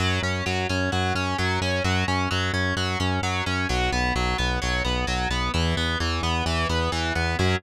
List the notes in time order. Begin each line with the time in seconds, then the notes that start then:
0.00 F#2 F#3
0.23 F#2 C#4
0.46 F#2 F#3
0.69 F#2 C#4
0.92 F#2 F#3
1.15 F#2 C#4
1.38 F#2 F#3
1.61 F#2 C#4
1.84 F#2 F#3
2.08 F#2 C#4
2.31 F#2 F#3
2.53 F#2 C#4
2.76 F#2 F#3
3.00 F#2 C#4
3.22 F#2 F#3
3.46 F#2 C#4
3.69 B1 F#3
3.92 B1 B3
4.15 B1 F#3
4.38 B1 B3
4.62 B1 F#3
4.85 B1 B3
5.07 B1 F#3
5.30 B1 B3
5.54 E2 E3
5.77 E2 B3
6.00 E2 E3
6.23 E2 B3
6.46 E2 E3
6.69 E2 B3
6.92 E2 E3
7.15 E2 B3
7.39 F#2 F#3 C#4